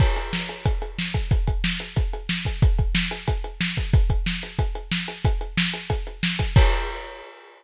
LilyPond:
\new DrumStaff \drummode { \time 4/4 \tempo 4 = 183 <cymc bd>8 hh8 sn8 hh8 <hh bd>8 hh8 sn8 <hh bd>8 | <hh bd>8 <hh bd>8 sn8 hh8 <hh bd>8 hh8 sn8 <hh bd>8 | <hh bd>8 <hh bd>8 sn8 hh8 <hh bd>8 hh8 sn8 <hh bd>8 | <hh bd>8 <hh bd>8 sn8 hh8 <hh bd>8 hh8 sn8 hh8 |
<hh bd>8 hh8 sn8 hh8 <hh bd>8 hh8 sn8 <hh bd>8 | <cymc bd>4 r4 r4 r4 | }